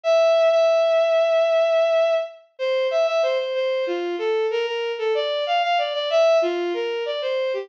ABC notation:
X:1
M:4/4
L:1/16
Q:1/4=94
K:F
V:1 name="Violin"
e3 e11 z2 | c2 e e c c c2 F2 A2 B B2 A | d2 f f d d e2 F2 B2 d c2 G |]